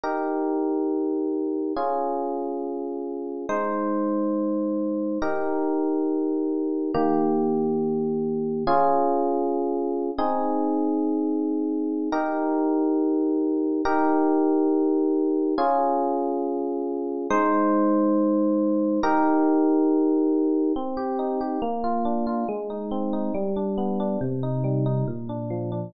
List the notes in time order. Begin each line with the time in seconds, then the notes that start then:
0.04 D#4 G4 A#4
1.77 C#4 F4 G#4
3.49 G#3 D#4 C5
5.22 D#4 G4 A#4
6.94 D#3 A#3 G4
8.67 C#4 F4 G#4
10.18 C4 D#4 G#4
12.12 D#4 G4 A#4
13.85 D#4 G4 A#4
15.58 C#4 F4 G#4
17.30 G#3 D#4 C5
19.03 D#4 G4 A#4
20.76 C4
20.97 G4
21.19 D#4
21.41 G4
21.62 A#3
21.84 F4
22.05 D4
22.27 F4
22.49 G#3
22.70 D#4
22.91 C4
23.13 D#4
23.34 G3
23.56 D4
23.78 B3
24.00 D4
24.21 C3
24.43 D#4
24.64 G3
24.86 D#4
25.08 A#2
25.29 D4
25.50 F3
25.72 D4